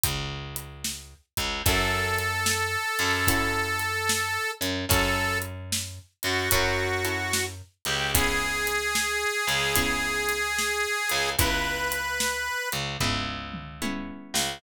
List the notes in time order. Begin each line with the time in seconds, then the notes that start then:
0.04 C#2, kick, closed hi-hat
0.56 closed hi-hat
0.84 snare
1.37 C#2, kick, closed hi-hat
1.66 F#2 C#4 E4 F#4 A4, kick, closed hi-hat
2.18 closed hi-hat
2.46 snare
2.99 F#2, closed hi-hat
3.27 C#4 E4 F#4 A4, kick, closed hi-hat
3.79 closed hi-hat
4.09 snare
4.61 F#2, closed hi-hat
4.89 F#2 C#4 E4 F#4 A4, kick, closed hi-hat
5.42 closed hi-hat
5.72 snare
6.23 F#2 F#4, closed hi-hat
6.51 F#2 C#4 E4 F#4 A4, kick, closed hi-hat
7.05 C#4 E4 F#4 A4, closed hi-hat
7.33 snare
7.85 C#2 G4, closed hi-hat
8.14 B3 C#4 E4 G#4, kick, closed hi-hat
8.67 closed hi-hat
8.95 snare
9.47 C#2, closed hi-hat
9.76 B3 C#4 E4 G#4, kick, closed hi-hat
10.29 closed hi-hat
10.58 snare
11.09 C#2, closed hi-hat
11.39 C#2 B3 C#4 E4 G#4 B4, kick, closed hi-hat
11.92 closed hi-hat
12.20 snare
12.72 C#2, closed hi-hat
13.00 C#2 B3 C#4 E4 G#4, kick, floor tom
13.54 mid tom
13.82 B3 C#4 E4 G#4, high tom
14.34 C#2, snare